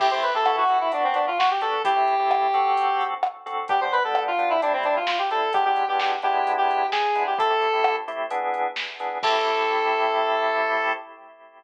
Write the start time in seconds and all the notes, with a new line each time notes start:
0.00 A3 C4 E4 G4, kick, crash
0.11 A3 C4 E4 G4 C5
0.23 B4, closed hi-hat
0.34 A3 C4 E4 G4 A4
0.46 B3 E4 F#4 A4, cross-stick
0.57 F#4
0.69 B3 E4 F#4 A4, closed hi-hat
0.81 E4
0.92 B3 D4 F#4, closed hi-hat
1.04 C4
1.14 D4, closed hi-hat
1.27 F4
1.39 F#4, snare
1.51 G4
1.61 B3 D4 F#4 A4, closed hi-hat
1.85 A3 C4 E4 G4, kick, closed hi-hat
1.96 A3 C4 E4 G4
2.07 closed hi-hat
2.19 A3 C4 E4 G4
2.31 cross-stick
2.54 D3 C4 F#4 A4, closed hi-hat
2.77 closed hi-hat
3.01 closed hi-hat
3.23 cross-stick
3.46 D3 C4 F#4 A4, closed hi-hat
3.68 G3 B3 D4 G4, kick, closed hi-hat
3.81 G3 B3 D4 C5
3.92 B4, closed hi-hat
4.04 G3 B3 D4 A4
4.15 cross-stick
4.27 F4
4.38 G3 B3 D4, closed hi-hat
4.50 E4
4.62 A2 G3 C4 D4 E4, closed hi-hat
4.73 C4
4.83 D4, closed hi-hat
4.96 F4
5.07 F4, snare
5.19 G4
5.31 A2 G3 C4 E4 A4, closed hi-hat
5.53 E3 G#3 B3 D4 G4, kick, closed hi-hat
5.65 E3 G#3 B3 D4 G4
5.76 closed hi-hat
5.88 E3 G#3 B3 D4 G4
6.00 G4, snare
6.22 G#3 B3 D4 E4 G4, closed hi-hat
6.47 closed hi-hat
6.58 G4
6.71 closed hi-hat
6.92 G#4, snare
7.15 G#3 B3 D4 E4, closed hi-hat
7.27 G4
7.38 A3 C4 E4 G4 A4, kick, closed hi-hat
7.50 A3 C4 E4 G4
7.62 closed hi-hat
7.73 A3 C4 E4 G4
7.84 cross-stick
8.08 A3 C4 E4 G4, closed hi-hat
8.30 E3 B3 D4 G#4, closed hi-hat
8.54 closed hi-hat
8.76 snare
9.00 E3 B3 D4 G#4, closed hi-hat
9.23 A3 C4 E4 G4 A4, kick, crash